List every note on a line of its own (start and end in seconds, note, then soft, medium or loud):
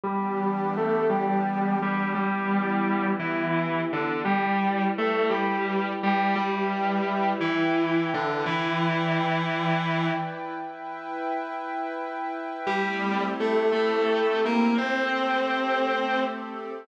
0.03 2.13 E3 medium
0.03 0.70 G3 loud
0.03 2.13 B3 medium
0.03 2.13 D4 medium
0.03 2.13 G4 medium
0.03 0.70 G4 loud
0.77 1.08 A3 medium
0.77 1.08 A4 loud
1.09 1.75 G3 medium
1.09 1.75 G4 medium
1.82 2.10 G3 loud
1.82 2.10 G4 loud
2.14 4.24 E3 medium
2.14 3.07 G3 medium
2.14 4.24 B3 medium
2.14 4.24 E4 medium
2.14 3.07 G4 medium
2.14 4.24 G4 medium
3.19 3.80 E3 medium
3.19 3.80 E4 loud
3.93 4.19 D3 medium
3.93 4.19 D4 loud
4.25 4.84 G3 loud
4.25 6.34 E4 medium
4.25 4.84 G4 loud
4.25 6.34 B4 medium
4.25 6.34 D5 medium
4.25 6.34 G5 medium
4.98 5.28 A3 medium
4.98 5.28 A4 loud
5.30 5.91 G3 medium
5.30 5.91 G4 loud
6.03 6.34 G3 loud
6.03 6.34 G4 loud
6.35 7.30 G3 medium
6.35 8.44 E4 medium
6.35 7.30 G4 medium
6.35 8.44 B4 medium
6.35 8.45 E5 medium
6.35 8.44 G5 medium
7.40 8.09 E3 medium
7.40 8.09 E4 medium
8.14 8.42 D3 medium
8.14 8.42 D4 loud
8.45 10.09 E3 loud
8.45 10.54 E4 medium
8.45 10.09 E4 loud
8.45 10.54 B4 medium
8.45 10.54 D5 medium
8.45 10.54 G5 medium
10.55 12.65 E4 medium
10.55 12.65 B4 medium
10.55 12.65 E5 medium
10.55 12.65 G5 medium
12.66 13.25 G3 loud
12.66 14.76 A3 medium
12.66 14.76 C4 loud
12.66 14.76 E4 medium
12.66 14.76 G4 medium
12.66 13.25 G4 loud
13.40 13.69 A3 loud
13.40 13.69 A4 loud
13.72 14.40 A3 medium
13.72 14.40 A4 loud
14.45 14.74 A#3 loud
14.45 14.74 A#4 loud
14.77 16.87 A3 medium
14.77 16.21 C4 medium
14.77 16.87 C4 medium
14.77 16.87 G4 medium
14.77 16.87 A4 medium
14.77 16.21 C5 loud